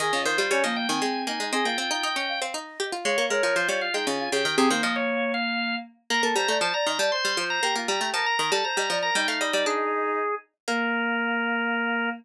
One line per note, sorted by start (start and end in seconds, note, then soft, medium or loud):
0.00 0.12 D#3 loud
0.00 0.12 G#4 loud
0.00 0.22 D#5 loud
0.13 0.25 C#3 medium
0.13 0.25 F4 loud
0.25 0.38 D#3 loud
0.25 0.46 F4 medium
0.25 0.38 C5 loud
0.38 0.50 G3 loud
0.38 0.50 C5 medium
0.51 0.63 G3 loud
0.51 0.63 C#4 medium
0.51 0.63 C#5 loud
0.64 0.87 F3 loud
0.64 0.86 A#3 loud
0.64 0.76 D#5 medium
0.76 0.88 G5 medium
0.89 1.01 D#3 loud
0.89 1.01 C4 medium
0.89 1.01 G#5 loud
1.01 1.26 G#3 medium
1.01 1.25 C4 medium
1.01 1.22 G#5 medium
1.27 1.39 A#3 medium
1.27 1.39 D#4 medium
1.27 1.49 G#5 loud
1.40 1.52 G#3 medium
1.40 1.52 D#4 medium
1.53 1.65 C4 loud
1.53 1.65 G#4 loud
1.53 1.65 D#5 loud
1.65 1.77 A#3 medium
1.65 1.77 F4 medium
1.65 2.40 G5 medium
1.78 1.90 C4 loud
1.78 1.90 F4 medium
1.91 2.03 D#4 loud
1.91 2.03 F4 medium
2.03 2.15 D#4 loud
2.03 2.27 D#5 medium
2.16 2.40 C#4 medium
2.29 2.41 F5 loud
2.42 2.54 C4 loud
2.42 2.54 F5 medium
2.54 2.78 D#4 loud
2.54 2.85 D#5 medium
2.80 2.92 G4 loud
2.92 3.05 F4 loud
2.92 3.04 F5 medium
3.05 3.17 G#3 loud
3.05 3.26 C#5 loud
3.05 3.17 F5 loud
3.18 3.30 A#3 loud
3.18 3.30 F5 medium
3.30 3.42 G#3 medium
3.30 3.43 A#4 medium
3.30 3.55 C#5 medium
3.43 3.55 F3 loud
3.43 3.55 A#4 medium
3.56 3.68 F3 medium
3.56 3.80 F4 medium
3.56 3.68 C5 loud
3.69 3.90 G3 loud
3.69 3.81 C#5 medium
3.81 3.93 F4 medium
3.81 3.93 F5 medium
3.94 4.06 G#3 medium
3.94 4.06 D#4 medium
3.94 4.06 G5 medium
4.07 4.29 C#3 loud
4.07 4.19 F4 medium
4.07 4.29 G#5 medium
4.19 4.31 F4 loud
4.32 4.44 C#3 loud
4.32 4.55 G4 medium
4.32 4.56 G5 loud
4.45 4.57 D#3 loud
4.58 4.70 C3 loud
4.58 4.70 C4 loud
4.58 4.70 G#4 loud
4.70 4.83 D#3 loud
4.70 5.75 A#3 medium
4.70 4.82 C5 medium
4.83 5.46 F3 loud
4.83 4.95 D#5 medium
4.96 5.32 C#5 medium
5.34 5.75 F5 medium
6.10 6.22 A#3 loud
6.10 6.22 A#4 medium
6.10 6.22 A#5 loud
6.23 6.35 A#3 loud
6.23 6.35 A4 loud
6.36 6.48 G3 loud
6.36 6.48 C5 medium
6.36 6.57 A#5 loud
6.48 6.60 A3 loud
6.48 6.60 D5 medium
6.61 6.73 F3 loud
6.61 6.73 C5 medium
6.61 6.73 A5 medium
6.74 6.86 D5 medium
6.74 6.86 A#5 medium
6.86 6.99 D#3 medium
6.86 6.99 D#5 loud
6.86 6.98 A#5 medium
6.99 7.11 G3 loud
6.99 7.11 D5 medium
6.99 7.11 A5 medium
7.12 7.32 C5 medium
7.12 7.44 C6 medium
7.25 7.37 G3 loud
7.37 7.60 F3 medium
7.37 7.62 C5 medium
7.50 7.62 A#5 medium
7.63 7.75 A#3 loud
7.63 7.75 G4 loud
7.63 7.75 A#5 loud
7.75 7.88 A#3 loud
7.75 7.88 F4 medium
7.88 8.00 G3 loud
7.88 8.12 G4 medium
7.88 8.09 A#5 medium
8.01 8.13 A3 loud
8.14 8.26 F3 medium
8.14 8.34 A#4 medium
8.14 8.26 A5 medium
8.26 8.38 A#5 medium
8.39 8.51 D#3 loud
8.39 8.51 A#4 medium
8.39 8.51 A#5 medium
8.52 8.64 G3 loud
8.52 8.64 A4 medium
8.52 8.64 A5 loud
8.64 8.76 C5 medium
8.64 8.98 A#5 medium
8.77 8.89 G3 loud
8.77 8.89 D#5 medium
8.90 9.11 F3 loud
8.90 9.02 D5 medium
9.02 9.15 A#4 medium
9.02 9.15 A#5 medium
9.15 9.27 G3 loud
9.15 10.19 D#4 loud
9.15 9.27 G5 loud
9.28 9.40 A3 loud
9.28 9.40 F5 medium
9.41 9.53 G3 medium
9.41 9.53 D#5 medium
9.53 9.65 G3 medium
9.53 9.65 D5 loud
9.66 10.49 D4 loud
9.66 10.35 G#4 loud
10.68 12.09 A#3 loud
10.68 12.10 A#4 loud